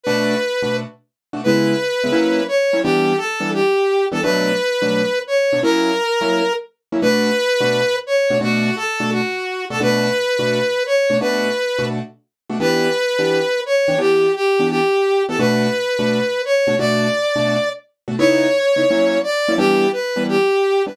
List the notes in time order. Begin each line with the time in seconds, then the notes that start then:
0.03 B2 A3 D4 F#4 B4
0.62 B2 A3 D4 F#4
1.33 B2 A3 D4 F#4
1.43 C#3 G#3 B3 E4 B4
2.04 C#3 G#3 B3 E4
2.12 F#3 A#3 C#4 E4
2.48 C#5
2.73 F#3 A#3 C#4 E4
2.83 E3 G3 B3 D4 G4
3.17 A4
3.40 E3 G3 B3 D4
3.53 G4
4.11 E3 G3 B3 D4 A4
4.22 B2 F#3 A3 D4 B4
4.82 B2 F#3 A3 D4
5.27 C#5
5.53 B2 F#3 A3 D4
5.63 F#3 A#3 C#4 E4 A#4
6.21 F#3 A#3 C#4 E4
6.92 F#3 A#3 C#4 E4
7.02 B2 A3 D4 F#4 B4
7.60 B2 A3 D4 F#4
8.06 C#5
8.30 B2 A3 D4 F#4
8.41 B2 A3 D4 F#4
8.76 A4
9.00 B2 A3 D4 F#4
9.12 F#4
9.70 B2 A3 D4 F#4 A4
9.80 B2 A3 D4 F#4 B4
10.39 B2 A3 D4 F#4
10.86 C#5
11.10 B2 A3 D4 F#4
11.20 B2 A3 D4 F#4 B4
11.79 B2 A3 D4 F#4
12.49 B2 A3 D4 F#4
12.60 E3 B3 D4 G4 B4
13.19 E3 B3 D4 G4
13.66 C#5
13.88 E3 B3 D4 G4
13.98 E3 B3 D4 G4
14.35 G4
14.59 E3 B3 D4 G4
14.70 G4
15.28 E3 B3 D4 G4 A4
15.39 B2 A3 D4 F#4 B4
15.99 B2 A3 D4 F#4
16.45 C#5
16.67 B2 A3 D4 F#4
16.79 B2 A3 D4 F#4 D5
17.36 B2 A3 D4 F#4
18.08 B2 A3 D4 F#4
18.19 C#3 B3 D#4 E4 C#5
18.76 C#3 B3 D#4 E4
18.90 F#3 A#3 C#4 E4
19.23 D5
19.48 F#3 A#3 C#4 E4
19.57 E3 G3 B3 D4 G4
19.92 B4
20.16 E3 G3 B3 D4
20.28 G4
20.86 E3 G3 B3 D4 B4